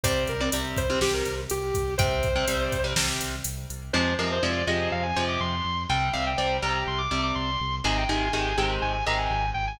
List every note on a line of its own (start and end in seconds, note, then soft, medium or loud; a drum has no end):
0.03 0.24 C2 medium
0.03 0.33 C3 medium
0.03 0.33 G3 loud
0.03 0.24 C5 loud
0.03 kick medium
0.03 closed hi-hat loud
0.27 0.49 C2 medium
0.27 0.41 A#4 medium
0.27 closed hi-hat medium
0.40 0.50 C3 medium
0.40 0.50 G3 medium
0.52 0.73 C2 medium
0.52 0.82 C3 medium
0.52 0.82 G3 medium
0.52 closed hi-hat loud
0.77 0.98 C2 medium
0.77 0.99 C5 medium
0.77 kick medium
0.77 closed hi-hat medium
0.90 0.99 C3 medium
0.90 0.99 G3 medium
1.01 1.22 C2 medium
1.01 1.41 C3 medium
1.01 1.41 G3 medium
1.01 1.13 G4 medium
1.01 snare medium
1.13 1.34 A#4 medium
1.25 1.47 C2 medium
1.25 closed hi-hat medium
1.50 1.71 C2 medium
1.50 1.94 G4 medium
1.50 closed hi-hat medium
1.74 1.95 C2 medium
1.74 kick medium
1.74 closed hi-hat medium
1.98 2.19 C2 medium
1.98 2.28 C3 loud
1.98 2.28 G3 medium
1.98 2.83 C5 loud
1.98 kick loud
1.98 closed hi-hat medium
2.23 2.44 C2 medium
2.23 kick medium
2.23 closed hi-hat medium
2.36 2.45 C3 medium
2.36 2.45 G3 medium
2.47 2.69 C2 medium
2.47 2.77 C3 medium
2.47 2.77 G3 medium
2.47 closed hi-hat loud
2.72 2.93 C2 medium
2.72 kick medium
2.72 closed hi-hat medium
2.84 2.94 C3 medium
2.84 2.94 G3 medium
2.96 3.17 C2 medium
2.96 3.35 C3 medium
2.96 3.35 G3 medium
2.96 snare loud
3.21 3.42 C2 medium
3.21 closed hi-hat medium
3.44 3.66 C2 medium
3.44 closed hi-hat loud
3.70 3.90 C2 medium
3.70 closed hi-hat medium
3.93 4.15 F2 loud
3.93 4.13 C3 loud
3.93 4.13 F3 loud
3.93 4.13 G#3 loud
3.93 4.15 C5 medium
4.19 4.39 F2 medium
4.19 4.38 C3 medium
4.19 4.38 F3 medium
4.19 4.38 G#3 medium
4.19 4.30 A#4 medium
4.32 4.44 C5 medium
4.42 4.64 F2 medium
4.42 4.62 C3 medium
4.42 4.62 F3 medium
4.42 4.62 G#3 medium
4.42 4.64 D5 medium
4.67 4.88 F2 medium
4.67 5.06 C3 medium
4.67 5.06 F3 medium
4.67 5.06 G#3 medium
4.67 4.89 D#5 medium
4.92 5.12 F2 medium
4.92 5.03 F5 loud
5.03 5.24 G#5 medium
5.16 5.37 F2 medium
5.16 5.55 C3 medium
5.16 5.55 F3 medium
5.16 5.55 G#3 medium
5.29 5.40 D6 medium
5.40 5.61 F2 medium
5.40 5.83 C6 medium
5.65 5.85 F2 medium
5.89 6.10 C2 loud
5.89 6.09 C3 medium
5.89 6.09 G3 loud
5.89 6.13 G5 loud
6.13 6.35 C2 medium
6.13 6.33 C3 medium
6.13 6.33 G3 medium
6.13 6.25 F5 medium
6.27 6.37 G5 medium
6.37 6.59 C2 medium
6.37 6.57 C3 medium
6.37 6.57 G3 medium
6.37 6.57 G5 medium
6.62 6.83 C2 medium
6.62 7.01 C3 medium
6.62 7.01 G3 medium
6.62 6.83 A#5 medium
6.87 7.07 C2 medium
6.87 6.99 C6 medium
6.98 7.21 D6 medium
7.11 7.32 C2 medium
7.11 7.50 C3 medium
7.11 7.50 G3 medium
7.23 7.35 D6 medium
7.35 7.57 C2 medium
7.35 7.75 C6 medium
7.60 7.81 C2 medium
7.84 8.05 G#1 loud
7.84 8.04 C3 loud
7.84 8.04 D#3 loud
7.84 8.04 G#3 loud
7.84 7.97 G#5 loud
7.97 8.09 G5 medium
8.09 8.29 G#1 medium
8.09 8.29 C3 medium
8.09 8.29 D#3 medium
8.09 8.29 G#3 medium
8.09 8.20 G#5 medium
8.21 8.32 G#5 medium
8.33 8.54 G#1 medium
8.33 8.53 C3 medium
8.33 8.53 D#3 medium
8.33 8.53 G#3 medium
8.33 8.56 G#5 medium
8.57 8.78 G#1 medium
8.57 8.97 C3 medium
8.57 8.97 D#3 medium
8.57 8.97 G#3 medium
8.57 8.70 G5 medium
8.82 9.02 G#1 medium
8.82 8.92 G#5 medium
8.93 9.04 G#5 medium
9.06 9.27 G#1 medium
9.06 9.45 C3 medium
9.06 9.45 D#3 medium
9.06 9.45 G#3 medium
9.06 9.19 A#5 medium
9.18 9.50 G#5 medium
9.31 9.51 G#1 medium
9.54 9.76 G#1 medium
9.54 9.66 G5 medium
9.67 9.79 G#5 medium